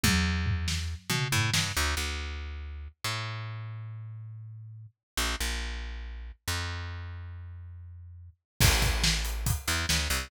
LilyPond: <<
  \new Staff \with { instrumentName = "Electric Bass (finger)" } { \clef bass \time 4/4 \key a \major \tempo 4 = 140 e,2~ e,8 b,8 a,8 g,8 | \key d \major d,8 d,2~ d,8 a,4~ | a,1 | bes,,8 bes,,2~ bes,,8 f,4~ |
f,1 | \key a \major a,,2~ a,,8 e,8 d,8 c,8 | }
  \new DrumStaff \with { instrumentName = "Drums" } \drummode { \time 4/4 <bd tommh>4 tomfh8 sn8 r8 toml8 tomfh8 sn8 | r4 r4 r4 r4 | r4 r4 r4 r4 | r4 r4 r4 r4 |
r4 r4 r4 r4 | <cymc bd>8 <hh bd>8 sn8 hh8 <hh bd>8 hh8 sn8 hh8 | }
>>